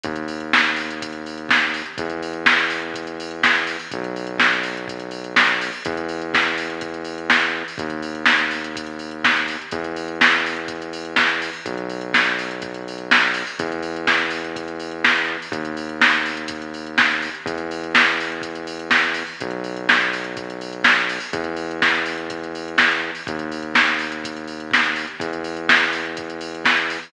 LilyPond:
<<
  \new Staff \with { instrumentName = "Synth Bass 1" } { \clef bass \time 4/4 \key b \dorian \tempo 4 = 124 dis,1 | e,1 | b,,1 | e,1 |
dis,1 | e,1 | b,,1 | e,1 |
dis,1 | e,1 | b,,1 | e,1 |
dis,1 | e,1 | }
  \new DrumStaff \with { instrumentName = "Drums" } \drummode { \time 4/4 <hh bd>16 hh16 hho16 hh16 <bd sn>16 hh16 hho16 hh16 <hh bd>16 hh16 hho16 hh16 <bd sn>16 hh16 hho16 hh16 | <hh bd>16 hh16 hho16 hh16 <bd sn>16 hh16 hho16 hh16 <hh bd>16 hh16 hho16 hh16 <bd sn>16 hh16 hho16 hho16 | <hh bd>16 hh16 hho16 hh16 <bd sn>16 hh16 hho16 hh16 <hh bd>16 hh16 hho16 hh16 <bd sn>16 hh16 hho16 hho16 | <hh bd>16 hh16 hho16 hh16 <bd sn>16 hh16 hho16 hh16 <hh bd>16 hh16 hho16 hh16 <bd sn>16 hh8 hho16 |
<hh bd>16 hh16 hho16 hh16 <bd sn>16 hh16 hho16 hh16 <hh bd>16 hh16 hho16 hh16 <bd sn>16 hh16 hho16 hh16 | <hh bd>16 hh16 hho16 hh16 <bd sn>16 hh16 hho16 hh16 <hh bd>16 hh16 hho16 hh16 <bd sn>16 hh16 hho16 hho16 | <hh bd>16 hh16 hho16 hh16 <bd sn>16 hh16 hho16 hh16 <hh bd>16 hh16 hho16 hh16 <bd sn>16 hh16 hho16 hho16 | <hh bd>16 hh16 hho16 hh16 <bd sn>16 hh16 hho16 hh16 <hh bd>16 hh16 hho16 hh16 <bd sn>16 hh8 hho16 |
<hh bd>16 hh16 hho16 hh16 <bd sn>16 hh16 hho16 hh16 <hh bd>16 hh16 hho16 hh16 <bd sn>16 hh16 hho16 hh16 | <hh bd>16 hh16 hho16 hh16 <bd sn>16 hh16 hho16 hh16 <hh bd>16 hh16 hho16 hh16 <bd sn>16 hh16 hho16 hho16 | <hh bd>16 hh16 hho16 hh16 <bd sn>16 hh16 hho16 hh16 <hh bd>16 hh16 hho16 hh16 <bd sn>16 hh16 hho16 hho16 | <hh bd>16 hh16 hho16 hh16 <bd sn>16 hh16 hho16 hh16 <hh bd>16 hh16 hho16 hh16 <bd sn>16 hh8 hho16 |
<hh bd>16 hh16 hho16 hh16 <bd sn>16 hh16 hho16 hh16 <hh bd>16 hh16 hho16 hh16 <bd sn>16 hh16 hho16 hh16 | <hh bd>16 hh16 hho16 hh16 <bd sn>16 hh16 hho16 hh16 <hh bd>16 hh16 hho16 hh16 <bd sn>16 hh16 hho16 hho16 | }
>>